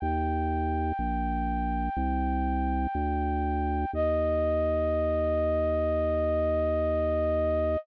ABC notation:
X:1
M:4/4
L:1/8
Q:1/4=61
K:Eb
V:1 name="Flute"
g8 | e8 |]
V:2 name="Drawbar Organ" clef=bass
E,,2 B,,,2 C,,2 D,,2 | E,,8 |]